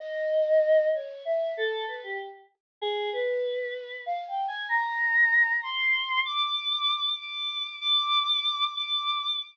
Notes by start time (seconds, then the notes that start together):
0.00 D#5
0.94 C#5
1.25 E5
1.57 A4
1.88 B4
2.03 G4
2.82 G#4
3.13 B4
4.06 F5
4.28 G5
4.48 G#5
4.69 A#5
5.63 C6
6.25 D6
7.19 D6
7.81 D6
8.75 D6